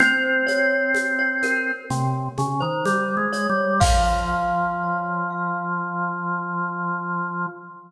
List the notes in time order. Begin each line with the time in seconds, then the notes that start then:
0.00 C4 C5, low conga, shaker
0.47 C#5, high conga, shaker
0.95 high conga, shaker
1.19 C#5
1.43 A#4, high conga, shaker
1.90 C3, low conga, shaker
2.38 C#3, high conga, shaker
2.60 D#3 C5
2.86 G3, high conga, shaker
3.17 G#3
3.33 C#5, shaker
3.49 G3
3.80 F3 F5, kick, crash